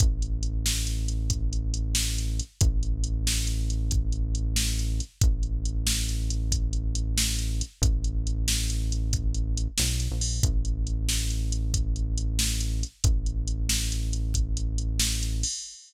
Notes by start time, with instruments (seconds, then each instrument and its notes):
0.00 synth bass 1 A1, kick, closed hi-hat
0.22 closed hi-hat
0.43 closed hi-hat
0.66 snare
0.87 closed hi-hat
1.08 closed hi-hat
1.30 kick, closed hi-hat
1.53 closed hi-hat
1.74 closed hi-hat
1.95 snare
2.18 closed hi-hat
2.39 closed hi-hat
2.61 synth bass 1 A1, kick, closed hi-hat
2.83 closed hi-hat
3.04 closed hi-hat
3.27 snare
3.47 closed hi-hat
3.70 closed hi-hat
3.91 kick, closed hi-hat
4.12 closed hi-hat
4.35 closed hi-hat
4.56 snare
4.79 closed hi-hat
5.00 closed hi-hat
5.21 synth bass 1 A1, kick, closed hi-hat
5.43 closed hi-hat
5.65 closed hi-hat
5.87 snare
6.09 closed hi-hat
6.30 closed hi-hat
6.52 kick, closed hi-hat
6.73 closed hi-hat
6.95 closed hi-hat
7.18 snare
7.39 closed hi-hat
7.61 closed hi-hat
7.82 synth bass 1 A1, kick, closed hi-hat
8.04 closed hi-hat
8.27 closed hi-hat
8.48 snare
8.70 closed hi-hat
8.92 closed hi-hat
9.13 kick, closed hi-hat
9.35 closed hi-hat
9.57 closed hi-hat
9.78 synth bass 1 B1, snare
10.00 closed hi-hat
10.11 synth bass 1 A#1
10.21 open hi-hat
10.43 synth bass 1 A1, kick, closed hi-hat
10.65 closed hi-hat
10.87 closed hi-hat
11.09 snare
11.30 closed hi-hat
11.52 closed hi-hat
11.74 kick, closed hi-hat
11.96 closed hi-hat
12.18 closed hi-hat
12.39 snare
12.61 closed hi-hat
12.83 closed hi-hat
13.04 synth bass 1 A1, kick, closed hi-hat
13.26 closed hi-hat
13.48 closed hi-hat
13.69 snare
13.92 closed hi-hat
14.13 closed hi-hat
14.34 kick, closed hi-hat
14.57 closed hi-hat
14.78 closed hi-hat
15.00 snare
15.23 closed hi-hat
15.43 open hi-hat